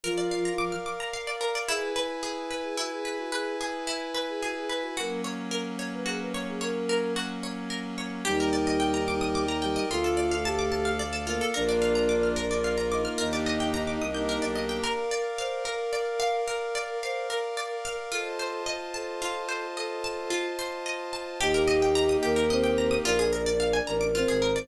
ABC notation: X:1
M:6/8
L:1/16
Q:3/8=73
K:Eblyd
V:1 name="Flute"
F4 z8 | [K:Elyd] z12 | z12 | z12 |
z12 | [K:Eblyd] E6 E6 | F4 G4 z4 | B6 B6 |
E4 z8 | [K:Bblyd] z12 | z12 | z12 |
z12 | [K:Eblyd] G6 B6 | B6 B6 |]
V:2 name="Flute"
[F,F]6 z6 | [K:Elyd] G2 z5 G F G G F | G2 z5 G F G B F | A2 z5 B G B c G |
A4 z8 | [K:Eblyd] [G,G]10 [G,G]2 | [A,A]10 [B,B]2 | [Dd]10 [Ee]2 |
[Ee]10 z2 | [K:Bblyd] B4 c2 B6 | B4 c2 B6 | A4 c2 A6 |
A4 z8 | [K:Eblyd] [Ee]8 [Cc]4 | [Dd]8 [Cc]4 |]
V:3 name="Pizzicato Strings"
B d f b d' f' d' b f d B d | [K:Elyd] E2 B2 G2 B2 E2 B2 | B2 G2 E2 B2 G2 B2 | F2 c2 A2 c2 F2 c2 |
c2 A2 F2 c2 A2 c2 | [K:Eblyd] G B d e g b d' e' d' b g e | F A d f a d' a f d A F A | B d f b d' f' B d f b d' f' |
B d e g b d' e' g' B d e g | [K:Bblyd] B2 d2 f2 B2 d2 f2 | B2 d2 f2 B2 d2 f2 | F2 c2 _e2 a2 F2 c2 |
_e2 a2 F2 c2 e2 a2 | [K:Eblyd] G B e g b e' G B e g b e' | F _A B d f _a b d' F A B d |]
V:4 name="Violin" clef=bass
z12 | [K:Elyd] z12 | z12 | z12 |
z12 | [K:Eblyd] E,,12 | D,,12 | B,,,12 |
E,,6 C,,3 =B,,,3 | [K:Bblyd] z12 | z12 | z12 |
z12 | [K:Eblyd] E,,6 E,,6 | B,,,6 A,,,3 _A,,,3 |]
V:5 name="Pad 5 (bowed)"
[Bdf]12 | [K:Elyd] [EBg]12- | [EBg]12 | [F,A,C]12- |
[F,A,C]12 | [K:Eblyd] [Bdeg]12 | [Adf]12 | [B,DF]6 [B,FB]6 |
[B,DEG]6 [B,DGB]6 | [K:Bblyd] [Bdf]12- | [Bdf]12 | [Fc_ea]12- |
[Fc_ea]12 | [K:Eblyd] [B,EG]12 | z12 |]